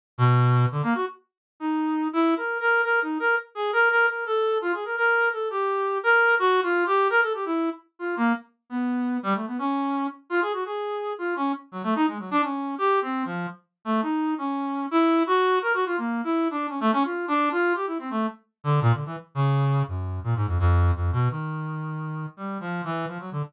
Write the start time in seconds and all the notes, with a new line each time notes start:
0.18 B2
0.71 D3
0.83 A#3
0.95 F#4
1.60 D#4
2.13 E4
2.37 A#4
2.60 A#4
2.84 A#4
3.02 D#4
3.20 A#4
3.55 G#4
3.73 A#4
3.90 A#4
4.08 A#4
4.26 A4
4.62 F4
4.74 G#4
4.85 A#4
4.97 A#4
5.33 A4
5.50 G4
6.03 A#4
6.39 F#4
6.63 F4
6.86 G4
7.10 A#4
7.22 A4
7.34 G4
7.46 E4
7.99 F4
8.17 A#3
8.70 B3
9.23 G3
9.35 A3
9.47 B3
9.59 C#4
10.30 F4
10.41 G#4
10.53 F#4
10.65 G#4
11.18 F4
11.36 C#4
11.72 F#3
11.83 A3
11.95 D#4
12.07 G#3
12.19 F#3
12.31 D4
12.43 C#4
12.78 G4
13.02 C4
13.25 F3
13.85 A3
14.02 D#4
14.38 C#4
14.91 E4
15.27 F#4
15.62 A#4
15.74 F#4
15.86 F4
15.97 A#3
16.24 E4
16.51 D4
16.69 C#4
16.80 A3
16.92 C#4
17.04 F4
17.28 D4
17.52 F4
17.75 G4
17.87 E4
17.99 C4
18.10 A3
18.64 D3
18.82 A#2
18.93 D3
19.05 E3
19.35 C#3
19.88 F#2
20.24 A#2
20.36 G#2
20.47 F2
20.59 F2
20.95 F2
21.12 B2
21.30 D#3
22.37 G3
22.60 F3
22.84 E3
23.08 F3
23.19 F#3
23.32 D3